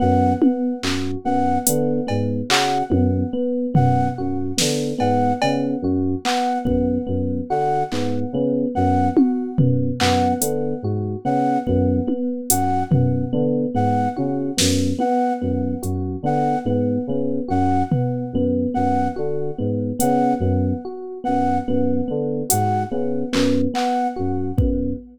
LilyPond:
<<
  \new Staff \with { instrumentName = "Electric Piano 2" } { \clef bass \time 6/8 \tempo 4. = 48 ges,8 r8 ges,8 ges,8 d8 aes,8 | des8 ges,8 r8 ges,8 ges,8 d8 | aes,8 des8 ges,8 r8 ges,8 ges,8 | d8 aes,8 des8 ges,8 r8 ges,8 |
ges,8 d8 aes,8 des8 ges,8 r8 | ges,8 ges,8 d8 aes,8 des8 ges,8 | r8 ges,8 ges,8 d8 aes,8 des8 | ges,8 r8 ges,8 ges,8 d8 aes,8 |
des8 ges,8 r8 ges,8 ges,8 d8 | aes,8 des8 ges,8 r8 ges,8 ges,8 | }
  \new Staff \with { instrumentName = "Electric Piano 1" } { \time 6/8 b8 b8 ges'8 b8 b8 b8 | ges'8 b8 b8 b8 ges'8 b8 | b8 b8 ges'8 b8 b8 b8 | ges'8 b8 b8 b8 ges'8 b8 |
b8 b8 ges'8 b8 b8 b8 | ges'8 b8 b8 b8 ges'8 b8 | b8 b8 ges'8 b8 b8 b8 | ges'8 b8 b8 b8 ges'8 b8 |
b8 b8 ges'8 b8 b8 b8 | ges'8 b8 b8 b8 ges'8 b8 | }
  \new Staff \with { instrumentName = "Flute" } { \time 6/8 ges''8 r4 ges''8 r4 | ges''8 r4 ges''8 r4 | ges''8 r4 ges''8 r4 | ges''8 r4 ges''8 r4 |
ges''8 r4 ges''8 r4 | ges''8 r4 ges''8 r4 | ges''8 r4 ges''8 r4 | ges''8 r4 ges''8 r4 |
ges''8 r4 ges''8 r4 | ges''8 r4 ges''8 r4 | }
  \new DrumStaff \with { instrumentName = "Drums" } \drummode { \time 6/8 r8 tommh8 hc8 r8 hh8 cb8 | hc8 tommh4 tomfh4 sn8 | cb8 cb4 hc8 bd4 | r8 hc4 r8 tommh8 tomfh8 |
hc8 hh4 r8 bd8 tommh8 | hh8 tomfh4 r8 tommh8 sn8 | tommh4 hh8 r4. | r8 tomfh4 r4. |
hh4. r4. | hh4 hc8 hc4 bd8 | }
>>